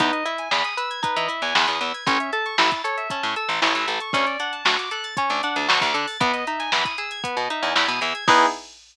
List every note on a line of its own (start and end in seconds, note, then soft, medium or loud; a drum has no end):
0.00 0.11 E2 loud
0.00 0.24 D#4 loud
0.00 0.12 B4 medium
0.00 kick medium
0.00 closed hi-hat medium
0.13 0.24 D#5 medium
0.13 closed hi-hat medium
0.26 0.49 E4 medium
0.26 0.37 E5 medium
0.26 closed hi-hat medium
0.38 0.50 G#5 medium
0.38 closed hi-hat medium
0.51 0.63 E2 medium
0.51 0.74 G#4 medium
0.51 0.63 B5 medium
0.51 snare medium
0.64 0.77 D#6 medium
0.64 closed hi-hat medium
0.77 1.01 B4 medium
0.77 0.89 E6 medium
0.77 closed hi-hat medium
0.90 1.02 G#6 medium
0.90 closed hi-hat medium
1.03 1.26 D#4 loud
1.03 1.16 B4 medium
1.03 kick medium
1.03 closed hi-hat medium
1.16 1.28 E3 loud
1.16 1.28 D#5 medium
1.16 closed hi-hat medium
1.28 1.52 E4 medium
1.28 1.41 E5 medium
1.28 closed hi-hat medium
1.42 1.54 E2 medium
1.42 1.54 G#5 medium
1.42 closed hi-hat medium
1.55 1.66 E2 loud
1.55 1.79 G#4 medium
1.55 1.67 B5 medium
1.55 snare loud
1.67 1.80 E2 medium
1.67 1.80 D#6 medium
1.67 closed hi-hat medium
1.81 1.92 E2 medium
1.81 2.04 B4 medium
1.81 1.93 E6 medium
1.81 closed hi-hat medium
1.94 2.06 G#6 medium
1.94 closed hi-hat medium
2.06 2.18 A1 loud
2.06 2.31 C#4 loud
2.06 2.19 C#5 medium
2.06 kick loud
2.06 closed hi-hat medium
2.20 2.32 E5 medium
2.20 closed hi-hat medium
2.33 2.56 A4 medium
2.33 2.44 A5 medium
2.33 closed hi-hat medium
2.46 2.57 C#6 medium
2.46 closed hi-hat medium
2.58 2.70 A1 loud
2.58 2.82 E4 medium
2.58 2.70 E6 medium
2.58 snare loud
2.71 2.83 A6 medium
2.71 kick medium
2.71 closed hi-hat medium
2.84 3.08 A4 medium
2.84 2.96 C#5 medium
2.84 closed hi-hat medium
2.97 3.09 E5 medium
2.97 closed hi-hat medium
3.10 3.34 C#4 medium
3.10 3.22 A5 medium
3.10 kick medium
3.10 closed hi-hat medium
3.23 3.35 A2 loud
3.23 3.35 C#6 medium
3.23 closed hi-hat medium
3.36 3.60 A4 medium
3.36 3.48 E6 medium
3.36 closed hi-hat medium
3.49 3.60 A1 loud
3.49 3.61 A6 medium
3.49 closed hi-hat medium
3.62 3.74 A1 loud
3.62 3.85 E4 medium
3.62 3.74 C#5 medium
3.62 snare loud
3.75 3.87 A1 medium
3.75 3.87 E5 medium
3.75 closed hi-hat medium
3.87 3.99 A1 medium
3.87 4.11 A4 medium
3.87 4.00 A5 medium
3.87 closed hi-hat medium
4.00 4.13 C#6 medium
4.00 closed hi-hat medium
4.13 4.25 D2 loud
4.13 4.37 C#4 loud
4.13 4.26 C#5 loud
4.13 kick medium
4.13 closed hi-hat loud
4.27 4.38 D5 medium
4.27 snare soft
4.27 closed hi-hat medium
4.40 4.63 D4 medium
4.40 4.52 F#5 medium
4.40 closed hi-hat medium
4.52 4.64 A5 medium
4.52 closed hi-hat medium
4.65 4.77 D2 loud
4.65 4.89 F#4 medium
4.65 4.77 C#6 medium
4.65 snare loud
4.78 4.90 D6 medium
4.78 closed hi-hat medium
4.91 5.15 A4 medium
4.91 5.03 F#6 medium
4.91 closed hi-hat medium
5.04 5.16 A6 medium
5.04 closed hi-hat medium
5.17 5.41 C#4 medium
5.17 5.29 C#5 medium
5.17 kick medium
5.17 closed hi-hat loud
5.30 5.42 D2 medium
5.30 5.42 D5 medium
5.30 closed hi-hat medium
5.43 5.67 D4 medium
5.43 5.55 F#5 medium
5.43 closed hi-hat medium
5.56 5.68 D2 medium
5.56 5.68 A5 medium
5.56 closed hi-hat medium
5.68 5.80 D2 loud
5.68 5.92 F#4 medium
5.68 5.81 C#6 medium
5.68 snare loud
5.81 5.93 D2 loud
5.81 5.93 D6 medium
5.81 kick medium
5.81 closed hi-hat medium
5.94 6.06 D3 loud
5.94 6.17 A4 medium
5.94 6.07 F#6 medium
5.94 closed hi-hat medium
6.08 6.19 A6 medium
6.08 open hi-hat medium
6.20 6.32 E2 loud
6.20 6.45 B3 loud
6.20 6.32 B4 medium
6.20 kick loud
6.20 closed hi-hat loud
6.33 6.45 D#5 medium
6.33 snare soft
6.33 closed hi-hat medium
6.47 6.71 D#4 medium
6.47 6.59 E5 medium
6.47 closed hi-hat medium
6.59 6.71 G#5 medium
6.59 snare soft
6.59 closed hi-hat medium
6.72 6.84 E2 loud
6.72 6.96 E4 medium
6.72 6.84 B5 medium
6.72 snare loud
6.85 6.97 D#6 medium
6.85 kick medium
6.85 closed hi-hat medium
6.98 7.21 G#4 medium
6.98 7.10 E6 medium
6.98 closed hi-hat medium
7.11 7.23 G#6 medium
7.11 closed hi-hat medium
7.24 7.47 B3 medium
7.24 7.36 B4 medium
7.24 kick medium
7.24 closed hi-hat loud
7.37 7.48 B2 medium
7.37 7.49 D#5 medium
7.37 closed hi-hat medium
7.50 7.74 D#4 medium
7.50 7.62 E5 medium
7.50 closed hi-hat medium
7.62 7.74 E2 loud
7.62 7.74 G#5 medium
7.62 closed hi-hat medium
7.75 7.87 E2 loud
7.75 7.99 E4 medium
7.75 7.88 B5 medium
7.75 snare loud
7.88 8.00 B2 medium
7.88 8.00 D#6 medium
7.88 closed hi-hat medium
8.01 8.13 E2 loud
8.01 8.24 G#4 medium
8.01 8.14 E6 medium
8.01 closed hi-hat medium
8.15 8.27 G#6 medium
8.15 closed hi-hat medium
8.27 8.46 E2 loud
8.27 8.46 B3 loud
8.27 8.46 D#4 loud
8.27 8.46 E4 loud
8.27 8.46 G#4 loud
8.27 8.46 B4 loud
8.27 kick loud
8.27 crash loud